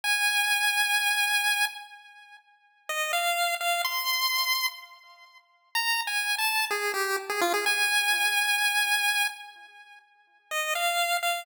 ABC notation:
X:1
M:4/4
L:1/16
Q:1/4=126
K:Ebmix
V:1 name="Lead 1 (square)"
a16 | z8 e2 f4 f2 | c'8 z8 | (3b4 a4 =a4 _A2 G2 z A F A |
a16 | z8 e2 f4 f2 |]